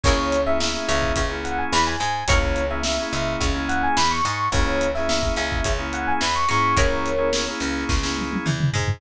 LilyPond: <<
  \new Staff \with { instrumentName = "Electric Piano 1" } { \time 4/4 \key cis \minor \tempo 4 = 107 cis''8. e''16 e''8 e''8. r16 fis''16 gis''16 b''16 gis''16 gis''8 | cis''8. e''16 e''8 e''8. r16 fis''16 gis''16 b''16 cis'''16 cis'''8 | cis''8. e''16 e''8 e''8. r16 fis''16 gis''16 b''16 cis'''16 cis'''8 | <ais' cis''>4. r2 r8 | }
  \new Staff \with { instrumentName = "Pizzicato Strings" } { \time 4/4 \key cis \minor <e' gis' ais' cis''>8 r4 cis'8 cis'4 e8 gis8 | <e' gis' ais' cis''>8 r4 cis'8 cis'4 e8 gis8 | r4. cis'8 cis'4 e8 gis8 | <e' gis' ais' cis''>8 r4 cis'8 cis'4 e8 gis8 | }
  \new Staff \with { instrumentName = "Drawbar Organ" } { \time 4/4 \key cis \minor <ais cis' e' gis'>8. <ais cis' e' gis'>16 <ais cis' e' gis'>16 <ais cis' e' gis'>4 <ais cis' e' gis'>4.~ <ais cis' e' gis'>16 | <ais cis' e' gis'>8. <ais cis' e' gis'>16 <ais cis' e' gis'>16 <ais cis' e' gis'>4 <ais cis' e' gis'>4.~ <ais cis' e' gis'>16 | <ais cis' e' gis'>8. <ais cis' e' gis'>16 <ais cis' e' gis'>16 <ais cis' e' gis'>4 <ais cis' e' gis'>4~ <ais cis' e' gis'>16 <ais cis' e' gis'>8~ | <ais cis' e' gis'>8. <ais cis' e' gis'>16 <ais cis' e' gis'>16 <ais cis' e' gis'>4 <ais cis' e' gis'>4.~ <ais cis' e' gis'>16 | }
  \new Staff \with { instrumentName = "Electric Bass (finger)" } { \clef bass \time 4/4 \key cis \minor cis,4. cis,8 cis,4 e,8 gis,8 | cis,4. cis,8 cis,4 e,8 gis,8 | cis,4. cis,8 cis,4 e,8 gis,8 | cis,4. cis,8 cis,4 e,8 gis,8 | }
  \new DrumStaff \with { instrumentName = "Drums" } \drummode { \time 4/4 <cymc bd>8 hh8 sn8 hh16 bd16 <hh bd>8 hh8 sn8 hh8 | <hh bd>16 bd16 hh8 sn16 sn16 hh8 <hh bd>8 hh8 sn8 hh8 | <hh bd>8 hh16 sn16 sn16 bd16 hh16 bd16 <hh bd>8 hh8 sn16 sn16 hh8 | <hh bd>8 hh8 sn8 hh16 sn16 <bd sn>16 sn16 tommh16 tommh16 toml16 toml16 tomfh16 tomfh16 | }
>>